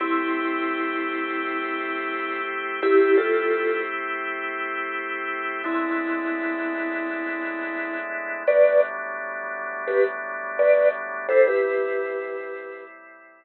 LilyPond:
<<
  \new Staff \with { instrumentName = "Vibraphone" } { \time 4/4 \key a \minor \tempo 4 = 85 <c' e'>1 | <e' g'>8 <f' a'>4 r2 r8 | <c' e'>1 | <b' d''>8 r4. <g' b'>16 r8. <b' d''>8 r8 |
<a' c''>16 <g' b'>2~ <g' b'>16 r4. | }
  \new Staff \with { instrumentName = "Drawbar Organ" } { \time 4/4 \key a \minor <a c' e' g'>1 | <a c' e' g'>1 | <a, gis b d' e'>1 | <a, fis g b d'>1 |
<a, g c' e'>1 | }
>>